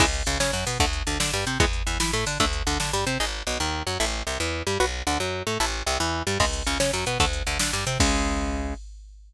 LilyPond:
<<
  \new Staff \with { instrumentName = "Overdriven Guitar" } { \time 6/8 \key cis \phrygian \tempo 4. = 150 <cis e gis>8 r8 cis8 cis'8 fis8 b8 | <d a>8 r8 d8 d'8 g8 bis8 | <e gis b>8 r8 e8 e'8 a8 d'8 | <d a>8 r8 d8 d'8 g8 bis8 |
\key gis \phrygian <dis' gis'>8 r8 b,8 dis4 fis8 | <e' a'>8 r8 c8 e4 g8 | <fis' b'>8 r8 d8 fis4 a8 | <e' a'>8 r8 c8 e4 g8 |
\key cis \phrygian <cis gis>8 r8 cis8 cis'8 fis8 b8 | <d a>8 r8 d8 d'8 g8 bis8 | <cis gis>2. | }
  \new Staff \with { instrumentName = "Electric Bass (finger)" } { \clef bass \time 6/8 \key cis \phrygian cis,4 cis,8 cis8 fis,8 b,8 | d,4 d,8 d8 g,8 bis,8 | e,4 e,8 e8 a,8 d8 | d,4 d,8 d8 g,8 bis,8 |
\key gis \phrygian gis,,4 b,,8 dis,4 fis,8 | a,,4 c,8 e,4 g,8 | b,,4 d,8 fis,4 a,8 | a,,4 c,8 e,4 g,8 |
\key cis \phrygian cis,4 cis,8 cis8 fis,8 b,8 | d,4 d,8 d8 g,8 bis,8 | cis,2. | }
  \new DrumStaff \with { instrumentName = "Drums" } \drummode { \time 6/8 <cymc bd>8 hh8 hh8 sn8 hh8 hho8 | <hh bd>8 hh8 hh8 sn8 hh8 hh8 | <hh bd>8 hh8 hh8 sn8 hh8 hho8 | <hh bd>8 hh8 hh8 sn8 hh8 hh8 |
r4. r4. | r4. r4. | r4. r4. | r4. r4. |
<cymc bd>8 hh8 hh8 sn8 hh8 hh8 | <hh bd>8 hh8 hh8 sn8 hh8 hh8 | <cymc bd>4. r4. | }
>>